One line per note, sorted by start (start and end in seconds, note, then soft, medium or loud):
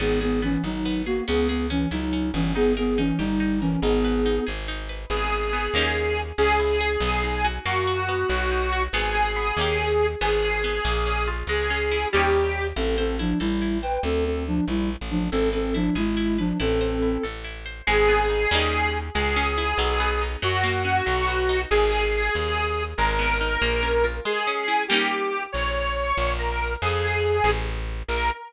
0.00 0.58 G#1 loud
0.00 0.19 B3 medium
0.00 0.42 B3 medium
0.00 0.19 G#4 medium
0.21 0.40 B3 medium
0.21 1.06 G#4 medium
0.21 0.40 G#4 medium
0.42 0.62 E3 medium
0.42 0.85 B3 medium
0.42 0.62 C#4 medium
0.64 1.21 G#1 medium
0.64 1.02 F#3 medium
0.64 1.02 D#4 medium
0.64 1.25 D#4 medium
0.85 1.26 B3 medium
1.06 1.24 A#3 medium
1.06 1.24 F#4 medium
1.06 1.27 G#4 medium
1.28 1.86 C#2 loud
1.28 1.48 B3 medium
1.28 1.70 C#4 medium
1.28 1.48 G#4 loud
1.48 1.66 B3 medium
1.48 1.66 G#4 medium
1.48 2.33 G#4 medium
1.70 1.88 E3 medium
1.70 2.12 C#4 medium
1.70 1.88 C#4 medium
1.91 2.32 C#2 medium
1.91 2.30 F#3 medium
1.91 2.30 D#4 medium
1.91 2.52 E4 medium
2.13 2.53 C#4 medium
2.34 3.13 G1 loud
2.34 2.52 E3 medium
2.34 2.52 C#4 medium
2.34 2.54 G#4 medium
2.55 2.73 B3 loud
2.55 2.98 D#4 medium
2.55 2.73 G#4 loud
2.77 2.98 B3 medium
2.77 2.98 G#4 loud
2.77 3.61 A#4 medium
2.98 3.19 E3 medium
2.98 3.19 C#4 medium
2.98 3.40 D#4 medium
3.18 3.77 G1 medium
3.18 3.60 G3 medium
3.18 3.60 D#4 medium
3.18 3.79 G4 medium
3.40 3.80 D#4 medium
3.61 3.80 E3 medium
3.61 3.80 C#4 medium
3.61 3.82 A#4 medium
3.82 4.40 G#1 loud
3.82 4.44 B3 medium
3.82 4.25 D#4 medium
3.82 4.44 G#4 loud
4.05 4.89 B4 medium
4.26 4.68 D#4 medium
4.47 5.06 G#1 medium
4.47 5.07 G#4 medium
4.68 5.09 D#4 medium
4.89 5.09 B4 medium
5.10 5.69 G#1 loud
5.10 5.52 B3 loud
5.10 6.21 G#4 medium
5.32 5.73 G#4 medium
5.53 5.73 B3 medium
5.74 6.32 D#2 loud
5.74 6.32 A#3 medium
5.74 6.32 C#4 loud
5.74 6.32 D#4 loud
5.78 6.32 G4 loud
6.38 6.97 C#2 loud
6.38 6.99 C#4 loud
6.38 7.46 G#4 medium
6.59 7.00 E4 medium
6.81 7.01 G#4 medium
7.00 7.59 B1 loud
7.00 7.62 B3 loud
7.23 7.64 D#4 medium
7.45 7.65 F#4 medium
7.66 8.24 F#2 loud
7.66 8.26 A#3 loud
7.66 8.83 F#4 medium
7.87 8.28 F#4 medium
8.09 8.91 B3 loud
8.30 8.88 B1 loud
8.51 8.92 D#4 medium
8.73 8.93 F#4 medium
8.93 9.52 G#1 loud
8.93 9.36 B3 loud
8.93 10.06 G#4 medium
9.15 9.55 G#4 medium
9.36 9.56 B3 medium
9.57 10.15 D#2 loud
9.57 10.15 A#3 loud
9.57 10.15 C#4 loud
9.57 10.15 D#4 loud
9.61 10.15 G4 loud
10.21 10.80 G#1 loud
10.21 10.64 B3 loud
10.21 11.29 G#4 medium
10.42 10.83 G#4 medium
10.64 10.84 B3 medium
10.85 11.43 A#1 loud
10.85 11.45 A#3 loud
11.06 11.47 C#4 medium
11.28 11.48 F4 medium
11.47 12.06 C#2 medium
11.47 12.10 G#3 loud
11.47 12.08 G#4 medium
11.70 12.11 C#4 medium
11.91 12.12 E4 medium
12.12 12.73 D#2 loud
12.12 12.70 G3 loud
12.12 12.70 A#3 loud
12.12 12.70 C#4 loud
12.12 12.67 G4 medium
12.17 12.70 D#4 medium
12.76 13.34 A1 loud
12.76 12.96 C4 medium
12.76 13.19 E4 medium
12.76 12.96 A4 medium
12.98 13.16 C4 medium
12.98 13.16 A4 medium
12.98 13.83 C5 medium
13.19 13.39 F3 medium
13.19 13.39 D4 medium
13.19 13.61 E4 medium
13.40 13.98 A1 medium
13.40 13.78 G3 medium
13.40 13.78 E4 medium
13.40 14.01 A4 medium
13.62 14.02 E4 medium
13.82 14.00 B4 medium
13.82 14.03 C5 medium
13.82 14.00 G5 medium
14.03 14.61 D2 loud
14.03 14.24 C4 medium
14.03 14.24 A4 medium
14.25 14.44 C4 medium
14.25 14.44 A4 medium
14.47 14.65 F3 medium
14.47 14.65 D4 medium
14.68 14.96 A#1 medium
14.68 14.90 G3 medium
14.68 14.90 E4 medium
15.01 15.30 A1 medium
15.10 15.28 F3 medium
15.10 15.28 D4 medium
15.32 15.90 G#1 loud
15.32 15.49 C4 medium
15.32 15.74 E4 medium
15.32 15.49 A4 loud
15.53 15.74 C4 medium
15.53 15.74 A4 medium
15.53 16.38 B4 medium
15.74 15.95 F3 medium
15.74 15.95 D4 medium
15.74 16.16 E4 medium
15.95 16.53 G#1 medium
15.95 16.38 G#3 medium
15.95 16.38 E4 medium
15.95 16.56 G#4 medium
16.17 16.57 E4 medium
16.38 16.58 F3 medium
16.38 16.58 D4 medium
16.38 16.59 B4 medium
16.60 17.18 A1 loud
16.60 17.23 C4 medium
16.60 17.02 E4 medium
16.60 17.23 A4 medium
16.81 17.65 C5 medium
17.02 17.44 E4 medium
17.23 17.82 A1 medium
17.23 17.84 A4 medium
17.44 17.85 E4 medium
17.66 17.86 C5 medium
17.87 18.46 G#1 loud
17.87 18.48 G#3 loud
17.87 18.98 G#4 loud
18.08 18.49 B3 medium
18.30 18.50 D#4 medium
18.51 19.10 D#2 loud
18.51 19.09 G3 loud
18.51 19.09 A#3 loud
18.51 19.09 C#4 loud
18.51 19.09 D#4 loud
19.15 19.74 C#2 loud
19.15 19.76 G#3 loud
19.15 20.23 G#4 loud
19.36 19.77 C#4 medium
19.58 19.78 E4 loud
19.78 20.36 B1 loud
19.78 20.39 F#3 loud
20.00 20.40 B3 medium
20.21 20.42 D#4 medium
20.42 21.02 F#2 loud
20.42 21.03 F#3 loud
20.42 21.61 F#4 loud
20.64 21.04 A#3 medium
20.85 21.05 C#4 medium
21.06 21.66 B1 loud
21.06 21.67 F#3 loud
21.28 21.68 B3 medium
21.49 21.69 D#4 medium
21.71 22.30 G#1 loud
21.71 22.83 G#4 loud
22.35 22.94 D#2 loud
22.98 23.57 G#1 loud
22.98 23.59 G#3 loud
22.98 24.05 A#4 loud
23.19 23.59 B3 medium
23.41 23.61 D#4 medium
23.62 24.20 A#1 loud
23.62 24.22 A#3 loud
23.83 24.23 C#4 medium
24.04 24.24 F4 medium
24.25 24.86 G#3 loud
24.25 24.84 G#4 loud
24.47 24.88 C#4 medium
24.68 24.88 E4 medium
24.88 25.47 G3 loud
24.88 25.47 A#3 loud
24.88 25.47 C#4 loud
24.88 25.43 G4 medium
24.93 25.47 D#4 loud
25.52 26.13 A#1 loud
25.52 26.32 C#5 medium
26.17 26.76 A#1 loud
26.39 26.73 A#4 medium
26.82 27.41 F2 loud
26.82 27.50 G#4 medium
27.44 28.03 A1 loud
28.08 28.31 A#1 loud
28.08 28.31 A#4 loud